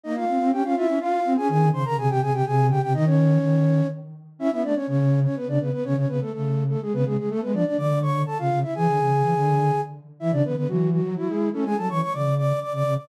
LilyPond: <<
  \new Staff \with { instrumentName = "Flute" } { \time 3/4 \key aes \major \tempo 4 = 124 <ees' ees''>16 <f' f''>8. <g' g''>16 <f' f''>16 <e' e''>8 <f' f''>8. <aes' aes''>16 | <aes' aes''>8 <c'' c'''>16 <bes' bes''>16 <aes' aes''>16 <g' g''>16 <aes' aes''>16 <g' g''>16 <aes' aes''>8 <g' g''>16 <g' g''>16 | <ees' ees''>16 <des' des''>4.~ <des' des''>16 r4 | \key a \major <e' e''>16 <e' e''>16 <d' d''>16 <cis' cis''>16 <cis' cis''>8. <cis' cis''>16 <b b'>16 <d' d''>16 <b b'>16 <b b'>16 |
<cis' cis''>16 <cis' cis''>16 <b b'>16 <a a'>16 <a a'>8. <a a'>16 <gis gis'>16 <b b'>16 <gis gis'>16 <gis gis'>16 | <a a'>16 <b b'>16 <d' d''>16 <d' d''>16 <d'' d'''>8 <cis'' cis'''>8 <a' a''>16 <f' f''>8 <e' e''>16 | <gis' gis''>2~ <gis' gis''>8 r8 | <e' e''>16 <d' d''>16 <b b'>16 <b b'>16 <fis fis'>8 <fis fis'>8 <fis fis'>16 <gis gis'>8 <a a'>16 |
<gis' gis''>16 <a' a''>16 <cis'' cis'''>16 <cis'' cis'''>16 <d'' d'''>8 <d'' d'''>8 <d'' d'''>16 <d'' d'''>8 <d'' d'''>16 | }
  \new Staff \with { instrumentName = "Flute" } { \time 3/4 \key aes \major bes8 c'16 c'16 des'16 des'16 f'16 des'16 f'8 c'16 des'16 | ees8 des16 des16 c16 c16 c16 c16 c8 des16 c16 | ees4 ees4 r4 | \key a \major cis'16 b16 a16 r16 cis4 r16 cis16 cis16 r16 |
cis16 cis16 cis16 r16 cis4 r16 cis16 cis16 r16 | a16 gis16 f16 r16 d4 r16 cis16 cis16 r16 | e16 d16 cis8 e16 d8. r4 | e16 cis16 d16 d16 e8. fis16 e'8. cis'16 |
gis16 fis16 e16 r16 cis4 r16 cis16 cis16 r16 | }
>>